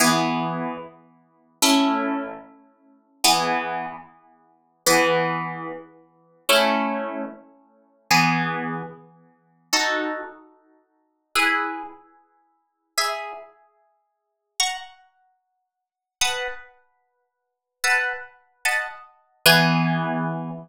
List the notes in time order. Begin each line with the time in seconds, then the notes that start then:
0.00 E3 B3 G#4
1.62 A3 C#4 E4
3.24 E3 B3 G#4
4.86 E3 B3 G#4
6.49 A3 C#4 E4
8.10 E3 B3 G#4
9.73 D#4 F#4 A4
11.35 E4 G#4 B4
12.97 G#4 E5 B5
14.60 F#5 A#5 C#6
16.21 B4 F#5 A5 D#6
17.84 B4 F#5 A5 E6
18.65 D#5 F#5 A5 B5
19.46 E3 B3 G#4